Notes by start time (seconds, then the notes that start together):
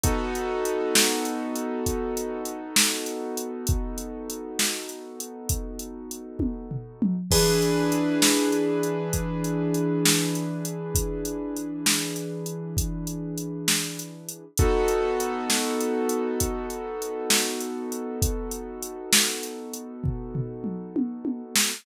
0.04 B3 D#4 F#4 A4, kick, closed hi-hat
0.35 closed hi-hat
0.65 closed hi-hat
0.95 snare
1.25 closed hi-hat
1.56 closed hi-hat
1.86 kick, closed hi-hat
2.17 closed hi-hat
2.45 closed hi-hat
2.76 snare
3.06 closed hi-hat
3.37 closed hi-hat
3.67 kick, closed hi-hat
3.98 closed hi-hat
4.30 closed hi-hat
4.59 snare
4.89 closed hi-hat
5.20 closed hi-hat
5.49 kick, closed hi-hat
5.79 closed hi-hat
6.11 closed hi-hat
6.39 kick, high tom
6.71 floor tom
7.02 mid tom
7.31 E3 D4 G#4 B4, kick, crash
7.62 closed hi-hat
7.92 closed hi-hat
8.22 snare
8.52 closed hi-hat
8.83 closed hi-hat
9.13 kick, closed hi-hat
9.44 closed hi-hat
9.74 closed hi-hat
10.05 snare
10.35 closed hi-hat
10.65 closed hi-hat
10.95 kick, closed hi-hat
11.25 closed hi-hat
11.56 closed hi-hat
11.86 snare
12.16 closed hi-hat
12.46 closed hi-hat
12.77 kick, closed hi-hat
13.07 closed hi-hat
13.38 closed hi-hat
13.68 snare
13.99 closed hi-hat
14.29 closed hi-hat
14.57 B3 D#4 F#4 A4, kick, closed hi-hat
14.88 closed hi-hat
15.20 closed hi-hat
15.50 snare
15.81 closed hi-hat
16.09 closed hi-hat
16.40 kick, closed hi-hat
16.70 closed hi-hat
17.02 closed hi-hat
17.30 snare
17.60 closed hi-hat
17.92 closed hi-hat
18.22 kick, closed hi-hat
18.51 closed hi-hat
18.82 closed hi-hat
19.13 snare
19.43 closed hi-hat
19.73 closed hi-hat
20.04 kick, floor tom
20.35 floor tom
20.64 mid tom
20.96 high tom
21.25 high tom
21.56 snare